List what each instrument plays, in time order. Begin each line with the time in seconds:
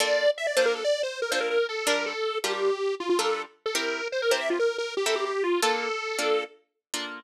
0.00 orchestral harp A#3 D4 F4 A4, lead 1 (square) D5
0.38 lead 1 (square) E5
0.47 lead 1 (square) D5
0.56 orchestral harp A#3 D4 F4 A4, lead 1 (square) C5
0.66 lead 1 (square) A#4
0.75 lead 1 (square) A4
0.84 lead 1 (square) D5
1.03 lead 1 (square) C5
1.22 lead 1 (square) A#4
1.31 orchestral harp A#3 D4 F4 A4, lead 1 (square) C5
1.41 lead 1 (square) A#4
1.50 lead 1 (square) A#4
1.69 lead 1 (square) A4
1.87 orchestral harp G3 D4 F4 A#4, lead 1 (square) A#4
2.06 lead 1 (square) A4
2.44 orchestral harp G3 D4 F4 A#4, lead 1 (square) G4
2.53 lead 1 (square) G4
3.00 lead 1 (square) F4
3.09 lead 1 (square) F4
3.19 orchestral harp G3 D4 F4 A#4, lead 1 (square) A4
3.66 lead 1 (square) A4
3.75 orchestral harp C4 E4 G4 A#4, lead 1 (square) A#4
4.12 lead 1 (square) C5
4.22 lead 1 (square) A#4
4.31 orchestral harp C4 E4 G4 A#4, lead 1 (square) C5
4.40 lead 1 (square) E5
4.50 lead 1 (square) F4
4.59 lead 1 (square) A#4
4.78 lead 1 (square) A#4
4.97 lead 1 (square) G4
5.06 orchestral harp C4 E4 G4 A#4, lead 1 (square) A4
5.16 lead 1 (square) G4
5.25 lead 1 (square) G4
5.44 lead 1 (square) F4
5.62 orchestral harp A#3 D4 F4 A4, lead 1 (square) A4
6.19 orchestral harp A#3 D4 F4 A4
6.94 orchestral harp A#3 D4 F4 A4